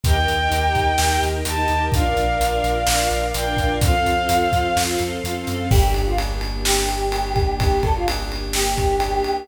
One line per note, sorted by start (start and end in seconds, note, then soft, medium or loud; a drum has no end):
0.03 0.24 D#2 loud
0.03 0.13 D#4 medium
0.03 0.13 G4 medium
0.03 1.91 A#4 medium
0.03 0.13 A#4 medium
0.03 1.91 D#5 medium
0.03 1.91 G5 medium
0.03 1.23 G5 medium
0.03 kick loud
0.03 closed hi-hat loud
0.16 0.35 D#4 medium
0.16 0.35 G4 medium
0.16 0.35 A#4 medium
0.28 0.48 D#2 medium
0.28 closed hi-hat medium
0.39 0.49 D#4 medium
0.39 0.49 G4 medium
0.39 0.49 A#4 medium
0.51 0.71 D#2 medium
0.51 0.89 D#4 medium
0.51 0.89 G4 medium
0.51 0.89 A#4 medium
0.51 closed hi-hat loud
0.75 0.95 D#2 medium
0.75 kick medium
0.75 closed hi-hat medium
0.98 1.19 D#2 medium
0.98 1.36 D#4 medium
0.98 1.36 G4 medium
0.98 1.36 A#4 medium
0.98 snare loud
1.22 1.42 D#2 medium
1.22 closed hi-hat medium
1.45 1.66 D#2 medium
1.45 1.55 D#4 medium
1.45 1.55 G4 medium
1.45 1.55 A#4 medium
1.45 1.85 A5 medium
1.45 closed hi-hat loud
1.58 1.67 D#4 medium
1.58 1.67 G4 medium
1.58 1.67 A#4 medium
1.68 1.89 D#2 medium
1.68 1.88 D#4 medium
1.68 1.88 G4 medium
1.68 1.88 A#4 medium
1.68 closed hi-hat medium
1.92 2.13 A#1 medium
1.92 2.02 D4 medium
1.92 2.02 F4 loud
1.92 3.80 A#4 medium
1.92 2.02 A#4 medium
1.92 3.80 D5 medium
1.92 3.80 F5 medium
1.92 3.26 F5 medium
1.92 kick loud
1.92 closed hi-hat loud
2.05 2.24 D4 medium
2.05 2.24 F4 medium
2.05 2.24 A#4 medium
2.17 2.37 A#1 medium
2.17 closed hi-hat medium
2.29 2.38 D4 medium
2.29 2.38 F4 medium
2.29 2.38 A#4 medium
2.40 2.60 A#1 medium
2.40 2.78 D4 medium
2.40 2.78 F4 medium
2.40 2.78 A#4 medium
2.40 closed hi-hat loud
2.64 2.84 A#1 medium
2.64 closed hi-hat medium
2.87 3.08 A#1 medium
2.87 3.25 D4 medium
2.87 3.25 F4 medium
2.87 3.25 A#4 medium
2.87 snare loud
3.11 3.31 A#1 medium
3.11 closed hi-hat medium
3.34 3.55 A#1 medium
3.34 3.44 D4 medium
3.34 3.44 F4 medium
3.34 3.44 A#4 medium
3.34 3.73 G5 medium
3.34 closed hi-hat loud
3.46 3.56 D4 medium
3.46 3.56 F4 medium
3.46 3.56 A#4 medium
3.57 3.78 A#1 medium
3.57 3.77 D4 medium
3.57 3.77 F4 medium
3.57 3.77 A#4 medium
3.57 kick medium
3.57 closed hi-hat medium
3.81 4.02 F2 medium
3.81 3.91 C4 loud
3.81 3.91 F4 loud
3.81 3.91 A4 medium
3.81 5.69 A4 medium
3.81 5.69 C5 medium
3.81 5.69 F5 medium
3.81 4.81 F5 medium
3.81 kick loud
3.81 closed hi-hat loud
3.94 4.13 C4 medium
3.94 4.13 F4 medium
3.94 4.13 A4 medium
4.06 4.26 F2 medium
4.06 closed hi-hat medium
4.17 4.27 C4 medium
4.17 4.27 F4 medium
4.17 4.27 A4 medium
4.29 4.49 F2 medium
4.29 4.67 C4 medium
4.29 4.67 F4 medium
4.29 4.67 A4 medium
4.29 closed hi-hat loud
4.52 4.73 F2 medium
4.52 kick medium
4.52 closed hi-hat medium
4.76 4.97 F2 medium
4.76 5.14 C4 medium
4.76 5.14 F4 medium
4.76 5.14 A4 medium
4.76 snare loud
4.99 5.20 F2 medium
4.99 closed hi-hat medium
5.24 5.45 F2 medium
5.24 5.33 C4 medium
5.24 5.33 F4 medium
5.24 5.33 A4 medium
5.24 closed hi-hat loud
5.36 5.45 C4 medium
5.36 5.45 F4 medium
5.36 5.45 A4 medium
5.47 5.69 F#2 medium
5.47 5.66 C4 medium
5.47 5.66 F4 medium
5.47 5.66 A4 medium
5.47 closed hi-hat medium
5.70 9.19 G1 loud
5.70 9.46 A#3 medium
5.70 9.46 D4 medium
5.70 5.93 G4 loud
5.70 9.46 G4 medium
5.70 kick loud
5.70 crash loud
5.94 6.07 G4 medium
5.94 ride medium
6.06 6.18 F4 medium
6.18 ride loud
6.41 ride medium
6.64 7.54 G4 medium
6.64 snare loud
6.89 ride medium
7.12 ride loud
7.36 kick loud
7.36 ride medium
7.58 7.81 G4 loud
7.58 kick loud
7.58 ride loud
7.82 7.93 A4 loud
7.82 kick loud
7.82 ride medium
7.95 8.07 F4 medium
8.08 ride loud
8.32 ride medium
8.53 9.44 G4 loud
8.53 snare loud
8.78 kick medium
8.78 ride medium
9.00 ride loud
9.24 ride medium